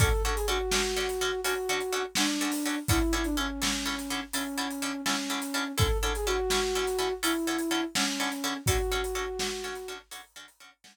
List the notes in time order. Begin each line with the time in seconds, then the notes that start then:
0.00 D3 C#4 F#4 A4, kick, closed hi-hat
0.24 D3 C#4 F#4 A4
0.35 G#4, closed hi-hat
0.48 D3 C#4 F#4 A4
0.71 D3 C#4 F#4 A4, snare
0.96 D3 C#4 F#4 A4
1.09 closed hi-hat
1.21 D3 C#4 F#4 A4
1.44 D3 C#4 F#4 A4, closed hi-hat
1.69 D3 C#4 F#4 A4
1.81 closed hi-hat
1.92 D3 C#4 F#4 A4
2.15 D3 C#4 D4 F#4 A4, snare
2.41 D3 C#4 F#4 A4
2.52 open hi-hat
2.66 D3 C#4 F#4 A4
2.88 D3 C#4 E4 A4, kick, closed hi-hat
3.13 D3 C#4 E4 A4
3.24 D4, closed hi-hat
3.37 D3 C#4 E4 A4
3.62 D3 C#4 E4 A4, snare
3.86 D3 C#4 E4 A4
3.99 closed hi-hat
4.10 D3 C#4 E4 A4
4.33 D3 C#4 E4 A4, closed hi-hat
4.58 D3 C#4 E4 A4
4.71 closed hi-hat
4.82 D3 C#4 E4 A4
5.06 D3 C#4 E4 A4, snare
5.30 D3 C#4 E4 A4
5.42 closed hi-hat
5.54 D3 C#4 E4 A4
5.78 D3 C#4 E4 A4, kick, closed hi-hat
6.02 D3 C#4 E4 A4
6.15 G#4, closed hi-hat
6.26 D3 C#4 E4 F#4 A4
6.50 D3 C#4 E4 A4, snare
6.75 D3 C#4 E4 A4
6.87 closed hi-hat
6.98 D3 C#4 E4 A4
7.23 D3 C#4 E4 A4, closed hi-hat
7.47 D3 C#4 E4 A4
7.59 closed hi-hat
7.71 D3 C#4 E4 A4
7.95 D3 C#4 E4 A4, snare
8.20 D3 C#4 E4 A4
8.32 closed hi-hat
8.44 D3 C#4 E4 A4
8.66 D3 C#4 F#4 A4, kick, closed hi-hat
8.92 D3 C#4 F#4 A4
9.04 closed hi-hat
9.15 D3 C#4 F#4 A4
9.39 D3 C#4 F#4 A4, snare
9.64 D3 C#4 F#4 A4
9.75 closed hi-hat
9.88 D3 C#4 F#4 A4
10.11 D3 C#4 F#4 A4, closed hi-hat
10.36 D3 C#4 F#4 A4
10.48 closed hi-hat
10.60 D3 C#4 F#4 A4
10.84 D3 C#4 F#4 A4, snare